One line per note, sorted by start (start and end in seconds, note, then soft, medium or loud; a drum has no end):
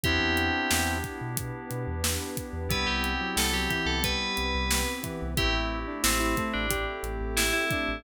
0.03 0.18 E2 medium
0.03 1.36 B3 medium
0.03 2.66 B3 medium
0.03 0.99 C4 medium
0.03 1.36 D4 medium
0.03 2.66 D4 loud
0.03 1.37 E4 medium
0.03 0.99 E4 loud
0.03 2.66 E4 medium
0.03 0.92 G4 loud
0.03 1.36 G4 medium
0.03 2.66 G4 loud
0.03 kick medium
0.03 closed hi-hat medium
0.20 0.50 E2 medium
0.37 closed hi-hat medium
0.71 1.01 E2 medium
0.71 snare loud
1.04 kick medium
1.04 closed hi-hat medium
1.21 1.51 B2 medium
1.37 2.69 B3 medium
1.37 2.69 D4 medium
1.37 2.69 G4 medium
1.37 2.69 B4 medium
1.37 kick medium
1.37 closed hi-hat loud
1.71 1.86 B2 medium
1.71 closed hi-hat medium
1.87 2.17 E2 medium
2.04 snare loud
2.37 kick medium
2.37 closed hi-hat medium
2.53 2.68 E2 medium
2.69 2.84 C2 medium
2.69 3.14 G3 loud
2.69 5.30 B3 medium
2.69 4.03 B3 medium
2.69 5.30 C4 loud
2.69 4.03 C4 loud
2.69 5.30 E4 medium
2.69 4.03 E4 medium
2.69 5.30 G4 medium
2.69 4.03 G4 medium
2.69 2.87 B4 medium
2.69 kick loud
2.69 closed hi-hat medium
2.87 3.17 C2 medium
2.87 3.28 G4 medium
3.04 closed hi-hat medium
3.21 3.37 F#3 medium
3.36 3.67 C2 medium
3.36 3.52 G3 loud
3.36 3.53 A4 medium
3.36 snare loud
3.53 3.69 F#3 loud
3.53 3.69 G4 medium
3.70 4.00 E3 loud
3.70 3.86 G4 medium
3.70 kick medium
3.70 closed hi-hat medium
3.86 4.16 C2 medium
3.86 4.02 A4 medium
4.02 4.83 G3 medium
4.02 5.36 B3 medium
4.02 5.36 C4 loud
4.02 5.36 G4 medium
4.02 5.36 B4 medium
4.02 4.91 B4 medium
4.02 kick medium
4.02 closed hi-hat medium
4.37 4.53 C2 medium
4.37 closed hi-hat medium
4.55 4.85 C2 medium
4.71 snare loud
5.03 5.34 E3 loud
5.03 kick medium
5.03 closed hi-hat medium
5.22 5.37 C2 medium
5.37 5.54 A1 loud
5.37 7.98 A3 medium
5.37 6.69 A3 medium
5.37 7.98 C4 medium
5.37 6.69 C4 medium
5.37 7.98 E4 medium
5.37 6.69 E4 medium
5.37 5.80 E4 loud
5.37 7.98 G4 medium
5.37 6.69 G4 loud
5.37 5.53 G4 loud
5.37 kick loud
5.37 closed hi-hat medium
5.54 5.84 A1 medium
5.87 6.03 D4 medium
6.03 6.34 A1 medium
6.03 6.44 C4 medium
6.03 6.19 E4 loud
6.03 snare loud
6.03 closed hi-hat medium
6.20 6.36 E4 loud
6.37 6.67 A3 loud
6.37 kick medium
6.37 closed hi-hat medium
6.53 6.85 A1 medium
6.53 6.84 D4 medium
6.71 8.03 A3 medium
6.71 8.03 C4 medium
6.71 7.65 G4 loud
6.71 8.03 G4 medium
6.71 8.03 A4 medium
6.71 kick medium
6.71 closed hi-hat loud
7.03 7.18 A1 medium
7.03 closed hi-hat medium
7.21 7.51 A1 medium
7.37 7.53 E4 loud
7.37 snare loud
7.53 7.99 E4 medium
7.71 8.03 D4 loud
7.71 kick medium
7.71 closed hi-hat medium
7.89 8.03 A1 medium